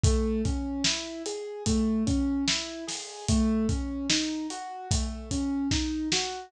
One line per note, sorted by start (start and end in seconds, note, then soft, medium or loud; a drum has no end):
0.04 0.42 A3 loud
0.04 kick loud
0.04 closed hi-hat medium
0.45 0.83 C#4 medium
0.45 kick medium
0.45 closed hi-hat medium
0.84 1.23 E4 medium
0.84 snare loud
1.26 1.64 G#4 medium
1.26 closed hi-hat medium
1.66 2.04 A3 medium
1.66 kick medium
1.66 closed hi-hat medium
2.07 2.44 C#4 medium
2.07 kick medium
2.07 closed hi-hat medium
2.47 2.85 E4 medium
2.47 snare loud
2.87 3.25 G#4 medium
2.87 snare medium
2.87 open hi-hat medium
3.28 3.67 A3 medium
3.28 kick medium
3.28 closed hi-hat medium
3.69 4.06 C#4 medium
3.69 kick medium
3.69 closed hi-hat medium
4.10 4.47 D#4 medium
4.10 snare loud
4.50 4.88 F#4 medium
4.50 closed hi-hat medium
4.91 5.29 A3 medium
4.91 kick medium
4.91 closed hi-hat loud
5.31 5.68 C#4 medium
5.31 kick medium
5.31 closed hi-hat medium
5.71 6.08 D#4 medium
5.71 kick medium
5.71 snare medium
6.12 6.50 F#4 medium
6.12 snare loud